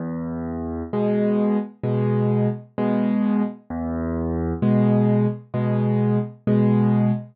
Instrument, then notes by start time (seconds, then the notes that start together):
acoustic grand piano
0.00 E2
0.93 B2 G#3
1.83 B2 G#3
2.78 B2 G#3
3.70 E2
4.62 B2 G#3
5.54 B2 G#3
6.47 B2 G#3